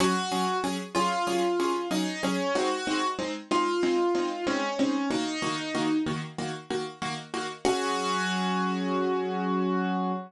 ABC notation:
X:1
M:4/4
L:1/8
Q:1/4=94
K:Gblyd
V:1 name="Acoustic Grand Piano"
G2 z F3 E D | G2 z F3 D D | E3 z5 | G8 |]
V:2 name="Acoustic Grand Piano"
[G,DA] [G,DA] [G,DA] [G,DA] [G,DA] [G,DA] [G,DA] [G,A] | [A,CE] [A,CE] [A,CE] [A,CE] [A,CE] [A,CE] [A,CE] [A,CE] | [E,B,G] [E,B,G] [E,B,G] [E,B,G] [E,B,G] [E,B,G] [E,B,G] [E,B,G] | [G,DA]8 |]